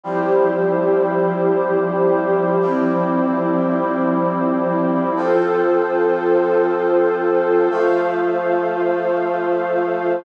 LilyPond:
<<
  \new Staff \with { instrumentName = "Brass Section" } { \time 4/4 \key f \major \tempo 4 = 94 <f g c' e'>1 | <f g e' g'>1 | <f c' a'>1 | <f a a'>1 | }
  \new Staff \with { instrumentName = "Pad 2 (warm)" } { \time 4/4 \key f \major <f e' g' c''>1 | <f c' e' c''>1 | <f' a' c''>1 | <f' c'' f''>1 | }
>>